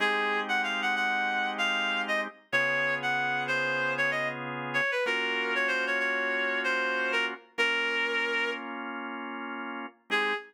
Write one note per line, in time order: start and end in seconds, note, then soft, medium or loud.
0.00 2.28 G#3 loud
0.00 2.28 C4 loud
0.00 2.28 D#4 loud
0.00 2.28 G4 loud
0.00 0.40 G#4 loud
0.49 0.61 F#5 medium
0.63 0.81 F5 medium
0.82 0.95 F#5 medium
0.96 1.50 F#5 medium
1.58 2.02 F5 loud
2.08 2.21 D#5 medium
2.52 4.81 C#3 loud
2.52 4.81 B3 loud
2.52 4.81 F4 loud
2.52 4.81 G#4 loud
2.52 2.94 C#5 loud
3.02 3.44 F#5 medium
3.48 3.93 C5 medium
3.98 4.10 C#5 loud
4.11 4.28 D#5 medium
4.74 4.91 C#5 medium
4.91 5.04 B4 medium
5.06 7.34 A#3 loud
5.06 7.34 C#4 loud
5.06 7.34 F4 loud
5.06 7.34 F#4 loud
5.06 5.54 A#4 medium
5.55 5.68 C#5 medium
5.68 5.85 C5 loud
5.87 5.99 C#5 medium
6.00 6.60 C#5 medium
6.64 7.12 C5 medium
7.12 7.25 A#4 loud
7.58 9.86 A#3 loud
7.58 9.86 C#4 loud
7.58 9.86 F4 loud
7.58 8.51 A#4 loud
10.10 10.33 G#3 loud
10.10 10.33 C4 loud
10.10 10.33 D#4 loud
10.10 10.33 G4 medium
10.10 10.34 G#4 loud